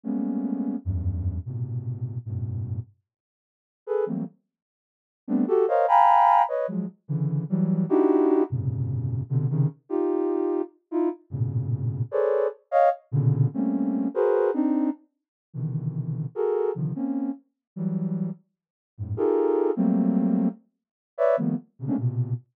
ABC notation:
X:1
M:7/8
L:1/16
Q:1/4=149
K:none
V:1 name="Ocarina"
[G,_A,=A,_B,=B,_D]8 [E,,_G,,=G,,]6 | [_A,,_B,,=B,,C,]8 [_G,,=G,,A,,=A,,B,,]6 | z10 [_A=AB]2 [E,_G,=G,A,_B,C]2 | z10 [G,A,B,CD]2 [_G=GA]2 |
[_Bc_d_ef]2 [fg_a_b=b]6 [=Bde]2 [F,_G,_A,]2 z2 | [_D,=D,E,]4 [E,_G,=G,]4 [D_E=E_G=G]6 | [_G,,_A,,_B,,=B,,C,_D,]8 [B,,C,=D,]2 [C,_D,_E,]2 z2 | [_EFG]8 z2 [E=EF]2 z2 |
[G,,A,,_B,,=B,,_D,]8 [_A=ABc_d=d]4 z2 | [_d_ef]2 z2 [_B,,=B,,_D,=D,]4 [G,A,_B,C_D]6 | [_G_A_B=Bc]4 [CD_E]4 z6 | [B,,C,D,_E,=E,]8 [_G_A=A_B]4 [C,D,_E,F,]2 |
[_B,C_D]4 z4 [E,_G,=G,]6 | z6 [_G,,_A,,=A,,]2 [_EF=G_A=A_B]6 | [_G,=G,A,_B,C]8 z6 | [B_d=de]2 [_E,F,G,A,_B,=B,]2 z2 [B,,C,_D,] [_A,=A,_B,C_D=D] [_B,,=B,,C,]4 z2 |]